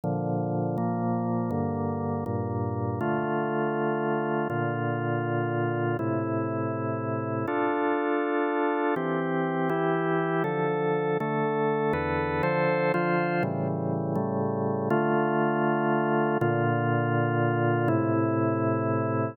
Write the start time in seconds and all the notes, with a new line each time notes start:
0.04 A#2 D3 F3
0.78 A#2 F3 A#3
1.51 G2 D3 A#3
2.26 G2 A#2 A#3
3.01 D3 A3 F4
4.50 A#2 D3 F4
5.99 A2 C3 E4
7.48 D4 F4 A4
8.96 E3 C4 G4
9.70 E3 E4 G4
10.44 D3 F3 A4
11.20 D3 A3 A4
11.93 E2 D3 A4 B4
12.43 D3 F3 A4 C5
12.94 D3 F3 F4 C5
13.43 A2 C#3 E3 G3
14.15 A2 C#3 G3 A3
14.90 D3 A3 F4
16.41 A#2 D3 F4
17.88 A2 C3 E4